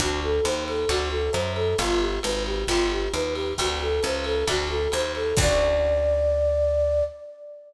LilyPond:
<<
  \new Staff \with { instrumentName = "Flute" } { \time 4/4 \key d \major \tempo 4 = 134 fis'8 a'8 c''8 a'8 fis'8 a'8 c''8 a'8 | f'8 g'8 b'8 g'8 f'8 g'8 b'8 g'8 | fis'8 a'8 c''8 a'8 fis'8 a'8 c''8 a'8 | d''1 | }
  \new Staff \with { instrumentName = "Acoustic Guitar (steel)" } { \time 4/4 \key d \major <c' d' fis' a'>2 <c' d' fis' a'>2 | <b d' f' g'>2 <b d' f' g'>2 | <a c' d' fis'>2 <a c' d' fis'>2 | <c' d' fis' a'>1 | }
  \new Staff \with { instrumentName = "Electric Bass (finger)" } { \clef bass \time 4/4 \key d \major d,4 dis,4 d,4 fis,4 | g,,4 gis,,4 g,,4 dis,4 | d,4 cis,4 d,4 dis,4 | d,1 | }
  \new DrumStaff \with { instrumentName = "Drums" } \drummode { \time 4/4 <bd cymr>4 <hhp cymr>8 cymr8 <bd cymr>4 <hhp cymr>8 cymr8 | <bd cymr>4 <hhp cymr>8 cymr8 <bd cymr>4 <hhp cymr>8 cymr8 | <bd cymr>4 <hhp cymr>8 cymr8 <bd cymr>4 <hhp cymr>8 cymr8 | <cymc bd>4 r4 r4 r4 | }
>>